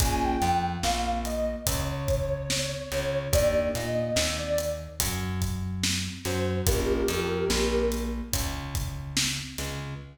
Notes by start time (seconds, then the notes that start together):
0.00 A#1 A#3 C#4 F4 G#4 G#5, kick, closed hi-hat
0.24 G5
0.41 F2 F3, closed hi-hat
0.83 A#1 A#3 F5, snare
1.25 D#5, closed hi-hat
1.66 C#2 C#3 C#5, kick, closed hi-hat
2.08 kick, closed hi-hat
2.50 snare
2.92 C#2 C#3, snare, closed hi-hat
3.33 D#2 A#3 D4 D#4 G4 D5, kick, closed hi-hat
3.75 A#2 A#3 D#5, closed hi-hat
3.96 D#5
4.16 D#2 D#3, snare
4.38 D5
4.58 closed hi-hat
5.00 F#2 F#3, kick, closed hi-hat
5.42 kick, closed hi-hat
5.84 snare
6.25 F#2 F#3 C5, snare, closed hi-hat
6.67 A#1 A#3 C#4 F4 G4 G#4 A#4, kick, closed hi-hat
7.08 F2 F3, closed hi-hat
7.49 A#1 A#3, snare
7.92 closed hi-hat
8.32 C#2 C#3, kick, closed hi-hat
8.75 kick, closed hi-hat
9.17 snare
9.58 C#2 C#3, snare, closed hi-hat